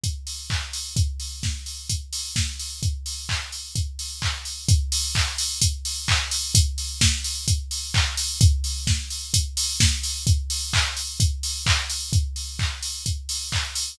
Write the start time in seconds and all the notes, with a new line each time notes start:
0.04 kick, closed hi-hat
0.27 open hi-hat
0.50 kick, clap
0.73 open hi-hat
0.96 kick, closed hi-hat
1.20 open hi-hat
1.43 kick, snare
1.66 open hi-hat
1.89 kick, closed hi-hat
2.13 open hi-hat
2.36 kick, snare
2.59 open hi-hat
2.83 kick, closed hi-hat
3.06 open hi-hat
3.29 kick, clap
3.52 open hi-hat
3.75 kick, closed hi-hat
3.99 open hi-hat
4.22 kick, clap
4.45 open hi-hat
4.68 kick, closed hi-hat
4.92 open hi-hat
5.15 kick, clap
5.38 open hi-hat
5.61 kick, closed hi-hat
5.85 open hi-hat
6.08 kick, clap
6.31 open hi-hat
6.55 kick, closed hi-hat
6.78 open hi-hat
7.01 kick, snare
7.24 open hi-hat
7.48 kick, closed hi-hat
7.71 open hi-hat
7.94 kick, clap
8.17 open hi-hat
8.41 kick, closed hi-hat
8.64 open hi-hat
8.87 kick, snare
9.10 open hi-hat
9.34 kick, closed hi-hat
9.57 open hi-hat
9.80 kick, snare
10.03 open hi-hat
10.27 kick, closed hi-hat
10.50 open hi-hat
10.73 kick, clap
10.97 open hi-hat
11.20 kick, closed hi-hat
11.43 open hi-hat
11.66 kick, clap
11.90 open hi-hat
12.13 kick, closed hi-hat
12.36 open hi-hat
12.59 kick, clap
12.83 open hi-hat
13.06 kick, closed hi-hat
13.29 open hi-hat
13.52 kick, clap
13.75 open hi-hat